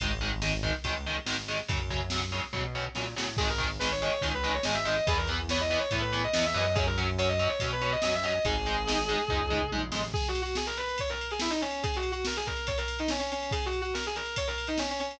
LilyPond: <<
  \new Staff \with { instrumentName = "Distortion Guitar" } { \time 4/4 \key gis \minor \tempo 4 = 142 r1 | r1 | gis'16 ais'16 r8 b'16 cis''8 cis''16 r16 b'8 cis''16 dis''16 e''16 dis''8 | gis'16 ais'16 r8 cis''16 dis''8 cis''16 r16 b'8 dis''16 dis''16 e''16 dis''8 |
gis'16 ais'16 r8 cis''16 dis''8 cis''16 r16 b'8 dis''16 dis''16 e''16 dis''8 | gis'2. r4 | \tuplet 3/2 { gis'8 fis'8 fis'8 } gis'16 ais'16 b'8 cis''16 ais'8 gis'16 e'16 dis'16 cis'8 | \tuplet 3/2 { gis'8 fis'8 fis'8 } ais'16 gis'16 ais'8 cis''16 ais'8 dis'16 cis'16 cis'16 cis'8 |
\tuplet 3/2 { gis'8 fis'8 fis'8 } ais'16 gis'16 ais'8 cis''16 ais'8 dis'16 cis'16 cis'16 cis'8 | }
  \new Staff \with { instrumentName = "Overdriven Guitar" } { \time 4/4 \key gis \minor <dis gis>8 <dis gis>8 <dis gis>8 <dis gis>8 <dis gis>8 <dis gis>8 <dis gis>8 <dis gis>8 | <cis fis>8 <cis fis>8 <cis fis>8 <cis fis>8 <cis fis>8 <cis fis>8 <cis fis>8 <cis fis>8 | <dis gis>8 <dis gis>8 <dis gis>8 <dis gis>8 <dis gis>8 <dis gis>8 <dis gis>8 <dis gis>8 | <e b>8 <e b>8 <e b>8 <e b>8 <e b>8 <e b>8 <e b>8 <e b>8 |
<fis cis'>8 <fis cis'>8 <fis cis'>8 <fis cis'>8 <fis cis'>8 <fis cis'>8 <fis cis'>8 <fis cis'>8 | <gis dis'>8 <gis dis'>8 <gis dis'>8 <gis dis'>8 <gis dis'>8 <gis dis'>8 <gis dis'>8 <gis dis'>8 | r1 | r1 |
r1 | }
  \new Staff \with { instrumentName = "Synth Bass 1" } { \clef bass \time 4/4 \key gis \minor gis,,2 cis,4 gis,,4 | fis,2 b,4 ais,8 a,8 | gis,,2 cis,4 gis,,4 | e,2 a,4 e,8 fis,8~ |
fis,2 b,4 fis,4 | gis,,2 cis,4 ais,,8 a,,8 | r1 | r1 |
r1 | }
  \new DrumStaff \with { instrumentName = "Drums" } \drummode { \time 4/4 <bd cymr>4 sn8 bd8 <bd cymr>4 sn8 sn8 | <bd cymr>8 bd8 sn4 bd4 sn8 sn8 | <cymc bd>8 <bd cymr>8 sn8 cymr8 <bd cymr>8 cymr8 sn8 cymr8 | <bd cymr>8 cymr8 sn8 cymr8 <bd cymr>8 cymr8 sn8 cymr8 |
<bd cymr>8 cymr8 cymr8 cymr8 <bd cymr>8 cymr8 sn8 cymr8 | <bd cymr>8 cymr8 sn8 cymr8 <bd tomfh>8 toml8 tommh8 sn8 | <cymc bd>16 cymr16 cymr16 cymr16 sn16 cymr16 cymr16 cymr16 <bd cymr>16 cymr16 cymr16 cymr16 sn16 cymr16 cymr16 cymr16 | <bd cymr>16 cymr16 cymr16 cymr16 sn16 cymr16 <bd cymr>16 cymr16 <bd cymr>16 cymr16 cymr16 cymr16 sn16 cymr16 cymr16 cymr16 |
<bd cymr>16 cymr16 cymr16 cymr16 sn16 cymr16 cymr16 cymr16 <bd cymr>16 cymr16 cymr16 cymr16 sn16 cymr16 cymr16 cymr16 | }
>>